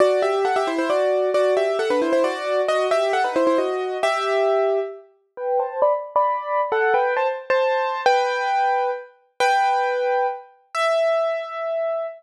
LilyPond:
\new Staff { \time 3/4 \key e \minor \tempo 4 = 134 <fis' d''>8 <g' e''>8 <a' fis''>16 <g' e''>16 <e' c''>16 <e' c''>16 <fis' d''>4 | <fis' d''>8 <g' e''>8 <a' fis''>16 <d' b'>16 <e' c''>16 <e' c''>16 <fis' d''>4 | <fis' dis''>8 <g' e''>8 <a' fis''>16 <dis' b'>16 <e' c''>16 <e' c''>16 <fis' dis''>4 | <g' e''>2 r4 |
\key g \major <b' g''>8 <c'' a''>8 <d'' b''>16 r8 <d'' b''>4~ <d'' b''>16 | <a' fis''>8 <b' g''>8 <c'' a''>16 r8 <c'' a''>4~ <c'' a''>16 | <b' g''>2 r4 | \key e \minor <b' g''>2 r4 |
e''2. | }